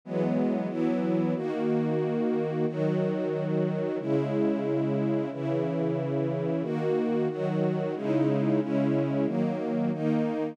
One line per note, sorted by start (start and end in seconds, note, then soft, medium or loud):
0.05 0.68 E3 medium
0.05 0.68 F#3 medium
0.05 0.70 G#3 medium
0.05 0.68 B3 loud
0.68 1.34 E3 medium
0.68 1.34 F#3 loud
0.68 1.34 B3 medium
0.68 1.34 E4 loud
1.35 2.66 D#3 loud
1.35 2.66 A#3 loud
1.35 2.66 F#4 medium
2.67 3.98 D#3 loud
2.67 3.98 F#3 loud
2.67 3.98 F#4 medium
3.99 5.30 C#3 loud
3.99 5.30 G#3 medium
3.99 5.30 E4 loud
5.32 6.63 C#3 loud
5.32 6.63 E3 medium
5.32 6.63 E4 medium
6.63 7.28 D#3 medium
6.63 7.28 A#3 loud
6.63 7.28 F#4 loud
7.29 7.95 D#3 loud
7.29 7.95 F#3 loud
7.29 7.95 F#4 loud
7.95 8.60 C#3 loud
7.95 8.60 G#3 medium
7.95 8.60 D#4 medium
7.95 8.60 E4 loud
8.60 9.26 C#3 loud
8.60 9.26 G#3 medium
8.60 9.26 C#4 medium
8.60 9.26 E4 medium
9.26 9.91 D#3 medium
9.26 9.91 F#3 medium
9.26 9.91 A#3 loud
9.93 10.57 D#3 loud
9.93 10.57 A#3 loud
9.93 10.57 D#4 loud